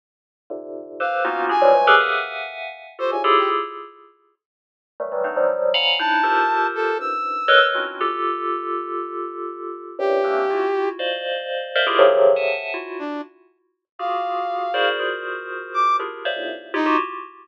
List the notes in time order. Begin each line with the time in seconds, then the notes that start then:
0.50 G#2 A#2 C3 D3
1.00 G4 A4 B4 C5 F5
1.25 A#3 B3 C#4 D#4 F4 F#4
1.49 D4 E4 F4 F#4 G4 G#4 G#5
1.61 E3 F3 F#3 G3 G#3
1.75 E3 F#3 G3 G#3 A3
1.87 G4 G#4 A4 A#4 B4
2.00 E5 F5 F#5 G#5
2.99 F4 F#4 G4 A4 C5
3.11 G#2 A2 A#2 C3 C#3 G#5
3.24 E4 F4 G4 G#4 A4
3.38 G4
5.00 D#3 E3 F#3 G3 A3
5.12 D#3 E3 F#3 G3
5.24 A3 B3 C4 D4 D#4
5.36 F3 F#3 G3
5.74 F5 F#5 G#5 A#5 B5
5.99 D4 D#4 E4 A5
6.23 F4 G4 A4 A#4 C5
6.75 A4
6.99 F#2 G2 G#2 E6
7.48 A4 A#4 B4 C#5 D#5
7.75 C4 C#4 D4 E4 F4 F#4
8.01 F4 G4 A4
9.99 F#2 G2 A2 A#2 C3 G4
10.24 A3 A#3 C4 C#4 D4
10.50 E4 F4 F#4
10.99 C5 D5 D#5 F5
11.76 A#4 C5 D5 D#5 E5 F5
11.87 E4 F4 G4 G#4 A#4
11.99 C3 C#3 D3 D#3 F3 F#3
12.36 E5 F#5 G#5 A5
12.74 E4 F4 F#4
12.99 D4
13.99 F4 F#4 G4 G#4 F5
14.74 E4 F#4 G#4 A#4 C5 D5
14.99 F4 F#4 G#4 A#4 C5
15.74 D6
16.00 D4 E4 F4 G4 G#4 A#4
16.25 C5 C#5 D5 E5 F5
16.36 E2 F#2 G#2 A2 A#2 C3
16.74 D#4 E4 F4 G4
16.86 F4 F#4 G4